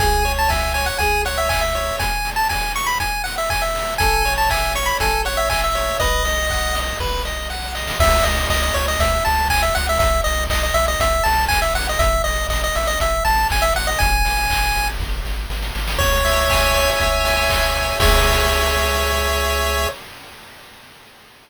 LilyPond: <<
  \new Staff \with { instrumentName = "Lead 1 (square)" } { \time 4/4 \key cis \minor \tempo 4 = 120 gis''8. a''16 gis''8 gis''16 fis''16 gis''8 fis''16 e''16 gis''16 e''8. | gis''8. a''16 gis''8 cis'''16 b''16 gis''8 fis''16 e''16 gis''16 e''8. | gis''8. a''16 gis''8 cis'''16 b''16 gis''8 fis''16 e''16 gis''16 e''8. | dis''2 r2 |
e''8 dis''8 dis''16 dis''16 cis''16 dis''16 e''8 a''8 gis''16 e''16 fis''16 e''16 | e''8 dis''8 dis''16 dis''16 e''16 dis''16 e''8 a''8 gis''16 e''16 fis''16 dis''16 | e''8 dis''8 dis''16 dis''16 e''16 dis''16 e''8 a''8 gis''16 e''16 fis''16 dis''16 | gis''2 r2 |
cis''2 r2 | cis''1 | }
  \new Staff \with { instrumentName = "Lead 1 (square)" } { \time 4/4 \key cis \minor gis'8 cis''8 e''8 cis''8 gis'8 cis''8 e''8 cis''8 | r1 | a'8 cis''8 e''8 cis''8 a'8 cis''8 e''8 cis''8 | b'8 dis''8 fis''8 dis''8 b'8 dis''8 fis''8 dis''8 |
r1 | r1 | r1 | r1 |
cis''8 e''8 gis''8 cis''8 e''8 gis''8 cis''8 e''8 | <gis' cis'' e''>1 | }
  \new Staff \with { instrumentName = "Synth Bass 1" } { \clef bass \time 4/4 \key cis \minor cis,2 cis,2 | r1 | a,,2 a,,2 | b,,2 b,,2 |
cis,8 cis,8 cis,8 cis,8 cis,8 cis,8 cis,8 cis,8 | b,,8 b,,8 b,,8 b,,8 b,,8 b,,8 b,,8 ais,,8 | a,,8 a,,8 a,,8 a,,8 a,,8 a,,8 a,,8 a,,8 | gis,,8 gis,,8 gis,,8 gis,,8 gis,,8 gis,,8 gis,,8 gis,,8 |
cis,2 cis,2 | cis,1 | }
  \new DrumStaff \with { instrumentName = "Drums" } \drummode { \time 4/4 <hh bd>8 hho8 <bd sn>8 hho8 <hh bd>8 hho8 <hc bd>8 hho8 | <hh bd>8 hho8 <bd sn>8 hho8 <hh bd>8 hho8 <hc bd>8 hho8 | <hh bd>8 hho8 <hc bd>8 hho8 <hh bd>8 hho8 <hc bd>8 hho8 | <hh bd>8 hho8 <hc bd>8 hho8 <bd sn>8 sn8 sn16 sn16 sn16 sn16 |
<cymc bd>8 hho8 <hc bd>8 hho8 <hh bd>8 hho8 <hc bd>8 hho8 | <hh bd>8 hho8 <hc bd>8 hho8 <hh bd>8 hho8 <hc bd>8 hho8 | <hh bd>8 hho8 <hc bd>8 hho8 <hh bd>8 hho8 <hc bd>8 hho8 | <hh bd>8 hho8 <hc bd>8 hho8 <bd sn>8 sn8 sn16 sn16 sn16 sn16 |
<cymc bd>8 hho8 <hc bd>8 hho8 <hh bd>8 hho8 <hc bd>8 hho8 | <cymc bd>4 r4 r4 r4 | }
>>